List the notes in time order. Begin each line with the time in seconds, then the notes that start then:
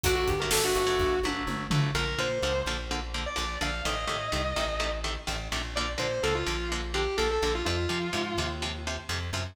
0.03 G1 D3 F#3 A3 F#4, kick, closed hi-hat
0.15 F#4
0.28 G1 G4, kick, closed hi-hat
0.40 D3 F#3 A3 A#4
0.51 G1 A4, snare
0.64 D3 F#3 A3 F#4
0.75 G1 F#4, closed hi-hat
0.87 D3 F#3 A3
0.99 G1, kick
1.23 G1 D3 F#3 A3, high tom
1.47 G1, mid tom
1.70 G1 D3 F#3 A3, floor tom
1.95 A#1 D3 F3 A#3 A#4
2.19 A#2 D3 F3 A#3 C5
2.42 C#2 D3 F3 A#3
2.66 A#1 D3 F3 A#3
2.91 D3 F3 A#3
3.14 D3 F3 A#3
3.26 D5
3.36 A#1 D3 F3 A#3
3.61 A#1 D3 F3 A#3 F5
3.85 A1 C3 D#3 A3 D#5
4.07 A2 C3 D#3 A3
4.32 C2 C3 D#3 A3
4.56 A1 C3 D#3 A3
4.80 C3 D#3 A3
5.04 C3 D#3 A3
5.27 A1 C3 D#3 A3
5.52 A#1 C3 D#3 A3
5.76 D3 F3 A#3 D5
5.98 A#2 D3 F3 A#3 C5
6.11 C5
6.23 C#2 D3 F3 A#3 A4
6.35 F4
6.47 A#1 D3 F3 A#3
6.72 D3 F3 A#3
6.94 D3 F3 A#3 G4
7.17 A#1 D3 F3 A#3 A4
7.31 A4
7.42 A#1 D3 F3 A#3
7.55 F4
7.65 F2 C3 F3 F4
7.89 C3 F3
8.13 G#2 C3 F3
8.38 D#2 C3 F3
8.62 C3 F3
8.87 C3 F3
9.09 F2 C3 F3
9.33 F#2 C3 F3